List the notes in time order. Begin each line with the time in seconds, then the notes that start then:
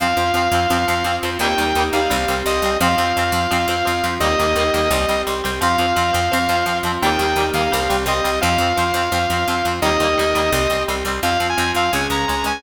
0.00 F2 F3 C4 F4 F5
0.17 F2 F3 C4
0.34 F2 F3 C4
0.52 F2 F3 C4
0.70 F2 F3 C4 F4
0.88 F2 F3 C4
1.04 F2 F3 C4
1.23 F2 F3 C4
1.39 D#2 D#3 G3 A#3 D#4 G4 G5
1.44 A#3
1.58 D#2 D#3 G3 A#3
1.75 D#2 D#3 G3
1.80 A#3
1.93 D#2 D#3 G3 F5
1.97 A#3
2.10 C2 G3 C4 G4
2.28 C2 G3 C4
2.46 C2 G3 C4 D#5
2.62 C2 G3 C4
2.80 F2 F3 C4 F4 F5
2.98 F2 F3 C4
3.17 F2 F3 C4
3.32 F2 F3 C4
3.51 F2 F3 C4 F4
3.68 F2 F3 C4
3.85 F2 F3 C4
4.04 F2 F3 C4
4.20 D#2 D#3 G3 A#3 D#4 G4 D#5
4.25 A#3
4.39 D#2 D#3 G3 A#3
4.56 D#2 D#3 G3
4.60 A#3
4.74 D#2 D#3 G3 A#3
4.91 C2 G3 C4 G4
5.09 C2 G3 C4
5.27 C2 G3 C4
5.44 C2 G3 C4
5.61 F2 F3 C4 F4 F5
5.78 F2 F3 C4
5.96 F2 F3 C4
6.13 F2 F3 C4
6.32 F2 F3 C4 F4
6.49 F2 F3 C4
6.66 F2 F3 C4
6.83 F2 F3 C4
7.02 D#2 D#3 G3 A#3 D#4 G4 G5
7.19 D#2 D#3 G3
7.23 A#3
7.36 D#2 D#3 G3
7.40 A#3
7.54 D#2 D#3 G3 F5
7.59 A#3
7.71 C2 G3 C4 G4
7.89 C2 G3 C4
8.06 C2 G3 C4 D#5
8.24 C2 G3 C4
8.41 F2 F3 C4 F4 F5
8.58 F2 F3
8.62 C4
8.77 F2 F3 C4
8.94 F2 F3 C4
9.12 F2 F3 C4 F4
9.30 F2 F3 C4
9.48 F2 F3 C4
9.65 F2 F3 C4
9.82 D#2 D#3 G3 A#3 D#4 G4 D#5
9.86 A#3
10.00 D#2 D#3 G3
10.04 A#3
10.18 D#2 D#3 G3 A#3
10.35 D#2 D#3 G3 A#3
10.51 C2 G3 C4 G4
10.70 C2 G3 C4
10.88 C2 G3 C4
11.05 C2 G3 C4
11.23 F2 F3 C4 F4 F5
11.40 F2 F3 C4
11.49 G#5
11.57 F2 F3 C4
11.75 F2 F3 C4 F5
11.92 C#2 G#3 C#4 G#4 G#5
12.10 C#2 G#3 C#4 A#5
12.28 C#2 G#3 C#4
12.44 C#2 G#3 C#4 G#5